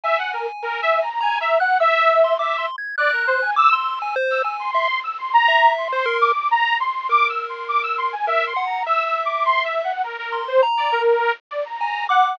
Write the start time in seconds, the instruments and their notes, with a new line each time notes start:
0.04 lead 2 (sawtooth) E5, lead 1 (square) G#5
0.18 lead 2 (sawtooth) F#5
0.33 lead 2 (sawtooth) A#4
0.62 lead 2 (sawtooth) A#4
0.82 lead 2 (sawtooth) E5
1.02 lead 2 (sawtooth) A#5
1.21 lead 2 (sawtooth) G#5, lead 1 (square) A#5
1.41 lead 2 (sawtooth) E5, lead 1 (square) A#5
1.60 lead 2 (sawtooth) F#5, lead 1 (square) F#6
1.80 lead 2 (sawtooth) E5, lead 1 (square) E6
2.24 lead 1 (square) C6
2.39 lead 2 (sawtooth) E5, lead 1 (square) D6
2.58 lead 1 (square) C6
2.78 lead 1 (square) G#6
2.98 lead 2 (sawtooth) D5, lead 1 (square) F#6
3.12 lead 2 (sawtooth) A#4
3.27 lead 2 (sawtooth) C5
3.42 lead 2 (sawtooth) G#5
3.56 lead 1 (square) D6, lead 2 (sawtooth) E6
3.73 lead 1 (square) C6, lead 2 (sawtooth) E6
3.96 lead 2 (sawtooth) E6
4.02 lead 1 (square) G#5
4.16 lead 1 (square) C5
4.30 lead 2 (sawtooth) E6
4.44 lead 1 (square) G#5
4.59 lead 2 (sawtooth) C6
4.75 lead 1 (square) E5
5.04 lead 2 (sawtooth) E6
5.18 lead 2 (sawtooth) C6
5.33 lead 2 (sawtooth) A#5
5.48 lead 1 (square) E5
5.77 lead 2 (sawtooth) C6
5.93 lead 1 (square) C5
6.06 lead 1 (square) A#4
6.21 lead 2 (sawtooth) D6
6.51 lead 2 (sawtooth) A#5
6.80 lead 2 (sawtooth) C6
7.09 lead 1 (square) A#4, lead 2 (sawtooth) D6
7.29 lead 2 (sawtooth) E6
7.49 lead 2 (sawtooth) C6
7.68 lead 2 (sawtooth) D6
7.83 lead 2 (sawtooth) E6
7.98 lead 2 (sawtooth) C6
8.12 lead 2 (sawtooth) G#5
8.27 lead 1 (square) A#4, lead 2 (sawtooth) E5
8.47 lead 2 (sawtooth) C6
8.56 lead 1 (square) F#5
8.66 lead 2 (sawtooth) A#5
8.86 lead 1 (square) E5, lead 2 (sawtooth) E6
9.06 lead 2 (sawtooth) E6
9.25 lead 2 (sawtooth) D6
9.45 lead 2 (sawtooth) C6
9.64 lead 2 (sawtooth) E5
9.84 lead 2 (sawtooth) F#5
10.04 lead 2 (sawtooth) A#4
10.18 lead 2 (sawtooth) A#4
10.32 lead 1 (square) C6
10.48 lead 2 (sawtooth) C5
10.63 lead 1 (square) A#5
10.77 lead 2 (sawtooth) D5
10.92 lead 2 (sawtooth) A#4
11.51 lead 2 (sawtooth) D5
11.65 lead 2 (sawtooth) A#5
11.81 lead 1 (square) G#5
12.09 lead 2 (sawtooth) F#5, lead 1 (square) D6